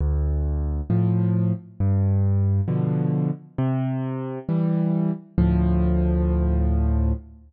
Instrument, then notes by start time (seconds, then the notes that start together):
acoustic grand piano
0.00 D2
0.90 A2 F3
1.80 G2
2.68 B2 D3 F3
3.58 C3
4.49 E3 G3
5.38 D2 A2 F3